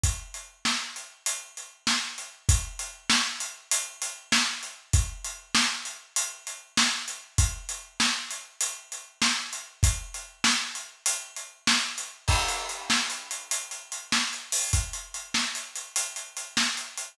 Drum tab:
CC |------------------------|------------------------|------------------------|------------------------|
HH |x--x-----x--x--x-----x--|x--x-----x--x--x-----x--|x--x-----x--x--x-----x--|x--x-----x--x--x-----x--|
SD |------o-----------o-----|------o-----------o-----|------o-----------o-----|------o-----------o-----|
BD |o-----------------------|o-----------------------|o-----------------------|o-----------------------|

CC |------------------------|x-----------------------|------------------------|
HH |x--x-----x--x--x-----x--|--x-x---x-x-x-x-x---x-o-|x-x-x---x-x-x-x-x---x-x-|
SD |------o-----------o-----|------o-----------o-----|------o-----------o-----|
BD |o-----------------------|o-----------------------|o-----------------------|